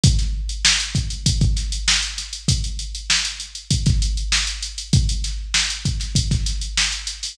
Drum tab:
HH |xx-x-xxxxxxx-xxx|xxxx-xxxxxxx-xxx|xxx--xxxxxxx-xxo|
SD |-o--o-----o-o-o-|----o----o--o---|--o-o--o-oo-o-oo|
BD |o-----o-oo------|o-------oo------|o-----o-oo------|